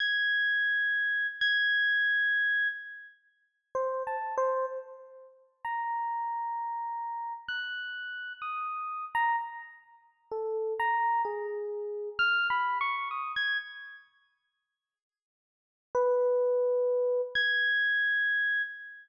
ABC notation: X:1
M:5/4
L:1/16
Q:1/4=64
K:none
V:1 name="Electric Piano 1"
^g'6 g'6 z4 (3c2 a2 c2 | z4 ^a8 ^f'4 ^d'3 a | z4 A2 ^a2 ^G4 (3f'2 b2 ^c'2 ^d' ^g' z2 | z8 B6 ^g'6 |]